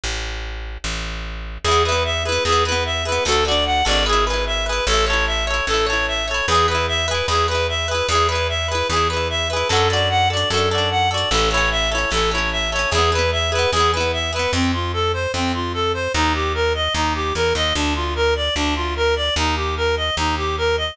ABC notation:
X:1
M:4/4
L:1/8
Q:1/4=149
K:Emix
V:1 name="Clarinet"
z8 | G B e B G B e B | A d f d G B e B | A c e c A c e c |
G B e B G B e B | G B e B G B e B | A d f d A d f d | A c e c A c e c |
G B e B G B e B | [K:Fmix] C F A c C F A c | E G B e E G B e | D F B d D F B d |
E G B e E G B e |]
V:2 name="Acoustic Guitar (steel)"
z8 | [B,EG] [B,EG]2 [B,EG] [B,EG] [B,EG]2 [B,EG] | [DFA] [DFA]2 [DFA] [EGB] [EGB]2 [EGB] | [EAc] [EAc]2 [EAc] [EAc] [EAc]2 [EAc] |
[EGB] [EGB]2 [EGB] [EGB] [EGB]2 [EGB] | [EGB] [EGB]2 [EGB] [EGB] [EGB]2 [EGB] | [DFA] [DFA]2 [DFA] [DFA] [DFA]2 [DFA] | [CEA] [CEA]2 [CEA] [CEA] [CEA]2 [CEA] |
[B,EG] [B,EG]2 [B,EG] [B,EG] [B,EG]2 [B,EG] | [K:Fmix] z8 | z8 | z8 |
z8 |]
V:3 name="Electric Bass (finger)" clef=bass
A,,,4 A,,,4 | E,,4 E,,4 | D,,3 G,,,5 | A,,,4 A,,,4 |
E,,4 E,,4 | E,,4 E,,4 | F,,4 F,,4 | A,,,4 A,,,4 |
E,,4 E,,4 | [K:Fmix] F,,4 F,,4 | E,,4 E,,2 =E,, _E,, | D,,4 D,,4 |
E,,4 E,,4 |]